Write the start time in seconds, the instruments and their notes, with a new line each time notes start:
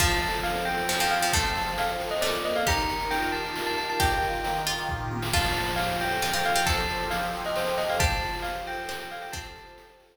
0.00 pizzicato strings F3, accordion F3, tubular bells A5, kick, crash
0.11 closed hi-hat
0.22 accordion A4, closed hi-hat
0.28 closed hi-hat
0.33 closed hi-hat
0.39 closed hi-hat
0.43 accordion C4, tubular bells F5, closed hi-hat
0.56 closed hi-hat
0.65 accordion A4, tubular bells G5, closed hi-hat
0.78 closed hi-hat
0.89 accordion F3, pizzicato strings F3, snare
1.00 pizzicato strings F3, tubular bells G5, closed hi-hat
1.11 accordion A4, tubular bells F5, closed hi-hat
1.17 closed hi-hat
1.21 pizzicato strings F3, tubular bells G5, closed hi-hat
1.28 closed hi-hat
1.33 pizzicato strings A3, accordion A4, tubular bells A5, kick, closed hi-hat
1.44 closed hi-hat
1.55 accordion C4, closed hi-hat
1.61 closed hi-hat
1.67 closed hi-hat
1.72 closed hi-hat
1.78 accordion F3, tubular bells F5, closed hi-hat
1.89 closed hi-hat
2.00 accordion A4, closed hi-hat
2.06 closed hi-hat
2.11 tubular bells D#5, closed hi-hat
2.17 closed hi-hat
2.21 pizzicato strings A3, accordion A#3, tubular bells D5, snare
2.34 closed hi-hat
2.44 accordion A4, tubular bells D#5, closed hi-hat
2.55 tubular bells F5, closed hi-hat
2.66 accordion D#3, pizzicato strings G4, tubular bells A#5, kick, closed hi-hat
2.78 closed hi-hat
2.89 accordion A#4, closed hi-hat
3.00 closed hi-hat
3.11 accordion F4, tubular bells G5, closed hi-hat
3.22 closed hi-hat
3.32 accordion G4, tubular bells A5, closed hi-hat
3.44 closed hi-hat
3.55 accordion D#3, snare
3.66 tubular bells A5, closed hi-hat
3.78 accordion A#4, tubular bells A5, closed hi-hat
3.89 tubular bells A5, closed hi-hat
3.99 accordion G4, pizzicato strings G4, tubular bells G5, kick, closed hi-hat
4.11 closed hi-hat
4.21 accordion F4, closed hi-hat
4.33 closed hi-hat
4.44 accordion D#3, closed hi-hat
4.56 closed hi-hat
4.66 pizzicato strings F4, accordion A#4, closed hi-hat
4.78 closed hi-hat
4.89 accordion F4, kick, floor tom
5.11 accordion G4, high tom
5.22 snare
5.33 accordion F3, pizzicato strings F4, tubular bells A5, kick, crash
5.44 closed hi-hat
5.55 accordion C5, closed hi-hat
5.67 closed hi-hat
5.76 accordion G4, tubular bells F5, closed hi-hat
5.89 closed hi-hat
6.00 accordion A4, tubular bells G5, closed hi-hat
6.11 closed hi-hat
6.22 accordion F3, pizzicato strings F4, snare
6.33 pizzicato strings F4, tubular bells G5, closed hi-hat
6.45 accordion C5, tubular bells F5, closed hi-hat
6.55 pizzicato strings F4, tubular bells G5, closed hi-hat
6.66 pizzicato strings A4, accordion A4, tubular bells A5, kick, closed hi-hat
6.78 closed hi-hat
6.89 accordion G4, closed hi-hat
7.00 closed hi-hat
7.10 accordion F3, tubular bells F5, closed hi-hat
7.22 closed hi-hat
7.33 accordion C5, closed hi-hat
7.45 tubular bells D#5, closed hi-hat
7.56 accordion G4, tubular bells C5, snare
7.67 closed hi-hat
7.78 accordion A4, tubular bells D#5, closed hi-hat
7.83 closed hi-hat
7.89 tubular bells F5, closed hi-hat
7.94 closed hi-hat
7.99 accordion F3, pizzicato strings G4, tubular bells A5, kick, closed hi-hat
8.11 closed hi-hat
8.22 accordion C5, closed hi-hat
8.28 closed hi-hat
8.33 closed hi-hat
8.39 tubular bells F5, closed hi-hat
8.44 accordion G4, closed hi-hat
8.55 closed hi-hat
8.66 accordion A4, tubular bells G5, closed hi-hat
8.72 closed hi-hat
8.78 closed hi-hat
8.83 closed hi-hat
8.89 accordion F3, pizzicato strings C5, snare
9.00 tubular bells G5, closed hi-hat
9.11 accordion C5, tubular bells F5, closed hi-hat
9.17 closed hi-hat
9.22 tubular bells G5, closed hi-hat
9.28 closed hi-hat
9.32 pizzicato strings C4, accordion A4, tubular bells A5, kick, closed hi-hat
9.44 closed hi-hat
9.56 accordion G4, closed hi-hat
9.67 closed hi-hat
9.78 accordion F3, closed hi-hat
9.89 closed hi-hat
10.00 accordion C5, closed hi-hat
10.05 closed hi-hat
10.11 closed hi-hat